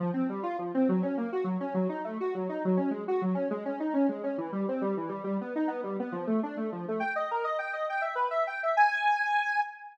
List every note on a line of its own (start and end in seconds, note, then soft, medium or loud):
0.00 0.11 F3 medium
0.14 0.27 C4 medium
0.29 0.43 G3 medium
0.43 0.57 F4 medium
0.59 0.72 F3 soft
0.74 0.88 C4 medium
0.89 1.02 F#3 medium
1.03 1.16 C#4 medium
1.17 1.31 A#3 medium
1.32 1.46 F#4 medium
1.44 1.58 F#3 medium
1.60 1.74 C#4 medium
1.74 1.88 F#3 medium
1.89 2.02 D#4 medium
2.04 2.18 A3 medium
2.20 2.34 F#4 medium
2.35 2.48 F#3 medium
2.49 2.62 D#4 medium
2.65 2.78 F#3 medium
2.77 2.90 C#4 medium
2.91 3.04 G#3 medium
3.08 3.21 F#4 medium
3.22 3.35 F#3 medium
3.35 3.48 C#4 medium
3.51 3.64 G#3 medium
3.65 3.79 C#4 medium
3.80 3.93 D#4 medium
3.94 4.07 C#4 medium
4.09 4.22 G#3 soft
4.23 4.37 C#4 medium
4.38 4.51 E3 medium
4.52 4.66 G3 medium
4.68 4.82 C4 medium
4.81 4.95 G3 medium
4.97 5.10 E3 medium
5.09 5.22 G3 medium
5.24 5.37 G3 medium
5.41 5.54 B3 medium
5.55 5.69 D#4 medium
5.68 5.81 B3 medium
5.83 5.97 G3 medium
6.00 6.13 B3 medium
6.12 6.25 F3 medium
6.27 6.40 A3 medium
6.43 6.57 D4 medium
6.57 6.70 A3 medium
6.72 6.86 F3 medium
6.88 7.02 A3 medium
7.00 7.13 G5 medium
7.16 7.29 D#5 medium
7.31 7.45 A#4 medium
7.44 7.58 D#5 medium
7.59 7.72 G5 medium
7.73 7.86 D#5 medium
7.89 8.03 G5 medium
8.01 8.15 E5 soft
8.15 8.29 B4 medium
8.31 8.44 E5 medium
8.47 8.60 G5 medium
8.63 8.76 E5 medium
8.77 9.60 G#5 loud